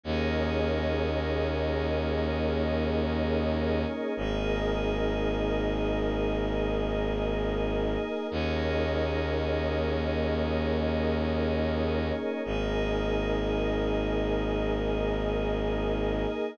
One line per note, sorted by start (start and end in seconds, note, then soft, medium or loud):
0.03 3.85 D#2 medium
0.03 4.13 A#3 medium
0.03 4.13 C#4 medium
0.03 4.13 D#4 medium
0.03 4.13 G#4 medium
0.03 4.13 A#4 medium
0.03 4.13 C#5 medium
0.03 4.13 D#5 medium
4.17 7.97 G#1 medium
4.17 8.27 A#3 medium
4.17 8.27 D#4 medium
4.17 8.27 G#4 medium
4.17 8.27 A#4 medium
4.17 8.27 D#5 medium
8.31 12.12 D#2 medium
8.31 12.41 A#3 medium
8.31 12.41 C#4 medium
8.31 12.41 D#4 medium
8.31 12.41 G#4 medium
8.31 12.41 A#4 medium
8.31 12.41 C#5 medium
8.31 12.41 D#5 medium
12.45 16.26 G#1 medium
12.45 16.54 A#3 medium
12.45 16.54 D#4 medium
12.45 16.54 G#4 medium
12.45 16.54 A#4 medium
12.45 16.54 D#5 medium